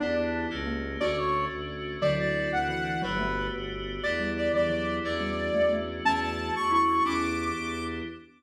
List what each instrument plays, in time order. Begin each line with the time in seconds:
0.00 violin E2, xylophone B3 D4, electric piano 2 B3 D4 E4 G4, lead 2 (sawtooth) D4
0.50 violin C#2, electric piano 2 A3 A#3 C#4 G4
0.67 xylophone A#3
1.00 violin D2, electric piano 2 A3 C#4 D4 F#4, xylophone D4 F#4, lead 2 (sawtooth) D5
1.17 lead 2 (sawtooth) C#5
1.51 violin D2
2.01 violin D2, xylophone D3 F#3, electric piano 2 C4 D4 E4 F#4, lead 2 (sawtooth) D5
2.19 lead 2 (sawtooth) D5
2.51 violin D2, lead 2 (sawtooth) F#5
2.68 xylophone E3, lead 2 (sawtooth) F#5
3.02 violin G1, xylophone F#3, electric piano 2 A3 B3 F#4 G4, lead 2 (sawtooth) B4
3.19 xylophone A3
3.53 violin G1
4.03 violin E2, electric piano 2 B3 D4 E4 G4, lead 2 (sawtooth) D5
4.20 xylophone G3
4.37 lead 2 (sawtooth) D5
4.54 violin E2, xylophone E3, lead 2 (sawtooth) D5
4.70 xylophone F#3
5.04 violin E2, electric piano 2 A3 C#4 D4 F#4, lead 2 (sawtooth) D5
5.21 xylophone G3
5.54 violin E2, xylophone A3
5.73 xylophone A3
6.05 violin E2, xylophone A3 C#4, electric piano 2 A3 C#4 D4 F#4, lead 2 (sawtooth) A5
6.22 lead 2 (sawtooth) A5
6.54 violin E2, lead 2 (sawtooth) C#6
6.71 xylophone E4, lead 2 (sawtooth) C#6
7.05 violin E2, electric piano 2 B3 D4 E4 G4, xylophone C#4 E4, lead 2 (sawtooth) D6
7.55 violin E2